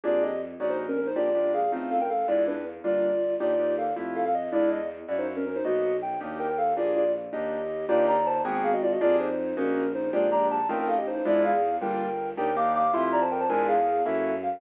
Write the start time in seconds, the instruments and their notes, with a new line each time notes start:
0.04 violin F2, acoustic grand piano A#3 D4 G4 G#4, ocarina F4 D5
0.22 ocarina G4 D#5
0.60 violin A#1, acoustic grand piano A#3 C#4 D#4 F#4, ocarina D5
0.69 ocarina D#4 C5
0.88 ocarina C#4 A#4
0.97 ocarina C#4 A#4
1.06 ocarina D#4 C5
1.15 violin A#1, acoustic grand piano G#3 A#3 D4 G4, ocarina F4 D5
1.35 acoustic grand piano G#3 A#3 D4 G4
1.54 ocarina G#4 F5
1.72 violin A1, acoustic grand piano A3 C4 D#4 F4
1.91 ocarina A4 F5
2.01 ocarina A#4 G5
2.10 ocarina A4 F5
2.28 violin E2, acoustic grand piano G#3 D4 E4 F4, ocarina E4 D5
2.47 ocarina D4 B4
2.83 violin G1, acoustic grand piano G3 A#3 D4 F4, ocarina F4 D5
3.40 violin D#2, acoustic grand piano A#3 D4 D#4 G4, ocarina F4 D5
3.59 acoustic grand piano A#3 D4 D#4 G4
3.78 ocarina A4 F5
3.96 violin F2, acoustic grand piano A3 E4 F4 G4
4.15 ocarina A4 F5
4.25 ocarina A4 F5
4.34 ocarina D#5
4.52 violin E2, acoustic grand piano G#3 D4 E4 F4, ocarina E4 D5
4.71 ocarina D#5
5.08 violin F#2, acoustic grand piano A#3 C#4 E4 F#4, ocarina D5
5.18 ocarina D#4 C5
5.36 ocarina C#4 A#4
5.46 ocarina C#4 A#4
5.55 ocarina D#4 C5
5.64 violin B1, acoustic grand piano A#3 B3 D#4 F#4, ocarina F#4 D#5
6.02 ocarina G5
6.21 violin D#2, acoustic grand piano A#3 D4 D#4 G4
6.39 ocarina A#4 G5
6.49 ocarina A#4 G5
6.58 ocarina A4 F5
6.76 violin A#1, acoustic grand piano A#3 D4 G4 G#4, ocarina F4 D5
6.95 ocarina F4 D5
7.33 violin D#2, acoustic grand piano A#3 D4 D#4 G4, ocarina G4 D#5
7.88 violin D#2, acoustic grand piano A#3 D4 D#4 G4, ocarina F4 D5
8.08 ocarina D5 A#5
8.26 ocarina C5 A5
8.44 violin G#1, acoustic grand piano A#3 B3 F#4 G#4, ocarina G5
8.54 ocarina G5
8.64 ocarina G#4 F5
8.73 ocarina F#4 D#5
8.82 ocarina F4 D5
8.92 ocarina F#4 D#5
9.01 violin F2, acoustic grand piano A#3 D4 G4 G#4, ocarina F4 D5
9.19 ocarina D#4 C5
9.57 violin A#1, acoustic grand piano A#3 C#4 D#4 F#4, ocarina C#4 A#4
9.94 ocarina D#4 C5
10.13 violin A#1, acoustic grand piano G#3 A#3 D4 G4, ocarina F4 D5
10.31 acoustic grand piano G#3 A#3 D4 G4, ocarina D5 A#5
10.50 ocarina A5
10.69 violin A1, acoustic grand piano A3 C4 D#4 F4, ocarina A#4 G5
10.79 ocarina A#4 G5
10.88 ocarina A4 F5
10.98 ocarina G4 D#5
11.07 ocarina D#4 C5
11.16 ocarina D#4 C5
11.25 violin E2, acoustic grand piano G#3 D4 E4 F4, ocarina E4 D5
11.44 ocarina G#4 F5
11.81 violin G1, acoustic grand piano G3 A#3 D4 F4, ocarina A#4 G5
12.37 violin D#2, acoustic grand piano A#3 D4 D#4 G4, ocarina A#4 G5
12.56 acoustic grand piano A#3 D4 D#4 G4, ocarina F5 D6
12.75 ocarina F5 D6
12.93 violin F2, acoustic grand piano A3 E4 F4 G4, ocarina E5 C6
13.03 ocarina E5 C6
13.12 ocarina D5 A#5
13.21 ocarina C5 A5
13.31 ocarina A#4 G5
13.40 ocarina C5 A5
13.49 violin E2, acoustic grand piano G#3 D4 E4 F4, ocarina A#4 G#5
13.68 ocarina G#4 F5
14.06 violin F#2, acoustic grand piano A#3 C#4 E4 F#4, ocarina A4 E5
14.43 ocarina F5